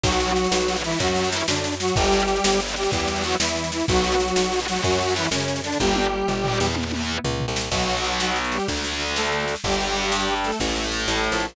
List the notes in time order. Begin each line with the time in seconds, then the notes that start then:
0.03 B1 F#3 B3 F#4, kick, snare, crash
0.12 snare
0.20 snare
0.28 snare
0.36 snare
0.44 snare
0.51 B1, snare
0.60 snare
0.68 F#3 B3, snare
0.76 snare
0.84 E3 F#3 B3 E4, snare
0.92 F#3 B3, snare
1.00 F#2 F#3 C#4 F#4, kick, snare
1.08 F#3 C#4, snare
1.16 F#3 C#4, snare
1.24 snare
1.32 E3 E4, snare
1.40 snare
1.48 F#2 D3 D4, snare
1.56 snare
1.64 snare
1.72 snare
1.80 F#3 F#4, snare
1.88 snare
1.96 G1 G3 D4 G4, kick, snare
2.04 snare
2.12 snare
2.20 snare
2.28 snare
2.36 snare
2.44 G1, snare
2.52 snare
2.60 G3 D4, snare
2.68 snare
2.76 G3 D4 G4, snare
2.84 G3 D4, snare
2.92 E2 G3 B3 E4 G4, kick, snare
3.00 B3 E4, snare
3.08 B3 E4, snare
3.16 snare
3.24 F#3 F#4, snare
3.32 snare
3.40 E2 E3 E4, snare
3.48 snare
3.56 snare
3.64 snare
3.72 E3 E4, snare
3.80 snare
3.88 B1 F#3 B3 F#4, kick, snare
3.96 snare
4.04 snare
4.12 snare
4.20 snare
4.28 snare
4.36 B1, snare
4.44 snare
4.52 B3 F#4, snare
4.60 snare
4.68 F#3 B3 F#4, snare
4.75 B3 F#4, snare
4.84 F#2 F#3 C#4 F#4, kick, snare
4.92 C#4 F#4, snare
5.00 C#4 F#4, snare
5.08 snare
5.16 E3 E4, snare
5.24 snare
5.31 F#2 C#3 C#4, snare
5.40 snare
5.48 snare
5.56 snare
5.64 D3 D4, snare
5.72 snare
5.80 G1 G3 D4 G4, kick, high tom
5.96 high tom
6.28 G1, floor tom
6.44 D4 G4, floor tom
6.60 E2 D4 G4, snare
6.68 D4 G4
6.76 B3 E4, high tom
6.84 B3 E4
6.92 B3 E4, high tom
7.24 C#2, floor tom
7.40 floor tom
7.48 C2
7.56 snare
7.71 B1 F#3 B3 F#4, kick, snare, crash
7.80 snare
7.88 snare
7.96 snare
8.04 snare
8.12 snare
8.20 snare
8.28 snare
8.36 snare
8.44 snare
8.52 G3 G4, snare
8.60 snare
8.68 D2 A3 D4, kick, snare
8.76 snare
8.84 snare
8.92 snare
9.00 snare
9.08 snare
9.16 A3 A4, snare
9.24 snare
9.32 snare
9.40 snare
9.48 snare
9.56 snare
9.64 G1 G3 D4 G4, kick, snare
9.72 snare
9.80 snare
9.88 snare
9.96 snare
10.04 snare
10.12 snare
10.20 snare
10.28 snare
10.36 snare
10.44 A3 A4, snare
10.52 snare
10.60 A1 A3 E4, kick, snare
10.68 snare
10.76 snare
10.84 snare
10.92 snare
11.00 snare
11.08 A1 A3 A4, snare
11.16 snare
11.24 snare
11.32 A#1, snare
11.40 snare
11.48 snare